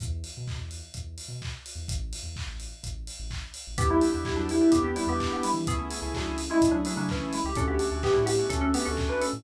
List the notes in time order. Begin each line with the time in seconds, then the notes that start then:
0.00 E2, kick, closed hi-hat
0.24 open hi-hat
0.37 B2
0.47 kick, clap
0.59 E2
0.71 open hi-hat
0.94 E2, kick, closed hi-hat
1.18 open hi-hat
1.28 B2
1.42 kick, clap
1.66 open hi-hat
1.75 E2
1.88 A1, kick, closed hi-hat
2.13 open hi-hat
2.23 E2
2.36 kick, clap
2.47 A1
2.60 open hi-hat
2.83 A1, kick, closed hi-hat
3.07 open hi-hat
3.19 A1
3.30 kick, clap
3.54 open hi-hat
3.67 A1
3.78 E2 B3 D4 E4 G4, kick, closed hi-hat
3.90 G3 B3 D4 E4 G4
4.01 B3 D4 E4 G4, open hi-hat
4.13 E2 B3 D4 E4 G4
4.25 G3 E4, kick, clap
4.36 E2 F#3 D4
4.49 G3 E4, open hi-hat
4.61 B3 D4 E4 G4
4.71 E2 B3 D4 E4 G4, kick, closed hi-hat
4.84 B3 G4
4.96 G3 B3 D4 E4 G4, open hi-hat
5.07 E2 B3 D4 E4 G4
5.20 kick, clap
5.32 B3 G4
5.43 G3 E4, open hi-hat
5.54 E3
5.66 C#2 A3 B3 C#4 E4 G#4, kick, closed hi-hat
5.79 A3 C#4 E4 G#4
5.90 A3 C#4 E4 G#4, open hi-hat
6.02 C#2 A3 C#4 E4 G#4
6.14 F#3 D4, kick, clap
6.27 C#2
6.38 open hi-hat
6.50 G#3 A3 C#4 E4 G#4
6.61 C#2 A3 C#4 E4 G#4, kick, closed hi-hat
6.71 F#3 D4
6.85 F#3 A3 C#4 D4 E4 G#4, open hi-hat
6.97 C#3 F#3 A3 C#4 D4 E4 G#4
7.09 E3 C#4, kick, clap
7.33 G#3 E4, open hi-hat
7.44 C#2 G4
7.55 D2 A3 C#4 D4 F#4 A4, kick, closed hi-hat
7.68 A3 B3 C#4 D4 F#4 G4
7.79 A3 C#4 D4 F#4, open hi-hat
7.91 D2 A3 C#4 D4 F#4
8.03 B3 G4, kick, clap
8.14 A2 G3 E4
8.26 B3 G4, open hi-hat
8.39 A3 C#4 D4 F#4
8.49 D2 A3 C#4 D4 F#4 A4, kick, closed hi-hat
8.61 C#4 A4
8.74 A3 B3 C#4 D4 F#4 G4, open hi-hat
8.85 D2 A3 C#4 D4 F#4 A4
8.97 kick, clap
9.09 D4 B4
9.21 C#4 A4, open hi-hat
9.33 A2